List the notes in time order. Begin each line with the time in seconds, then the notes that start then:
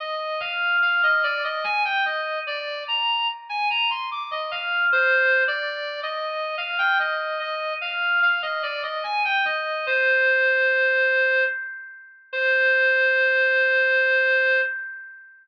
0.00 D#5
0.40 F5
0.82 F5
1.03 D#5
1.23 D5
1.44 D#5
1.64 G#5
1.85 G5
2.05 D#5
2.47 D5
2.88 A#5
3.49 G#5
3.70 A#5
3.90 C6
4.11 D6
4.31 D#5
4.51 F5
4.92 C5
5.48 D5
6.03 D#5
6.58 F5
6.78 G5
6.99 D#5
7.39 D#5
7.81 F5
8.22 F5
8.42 D#5
8.63 D5
8.83 D#5
9.04 G#5
9.25 G5
9.45 D#5
9.87 C5
12.33 C5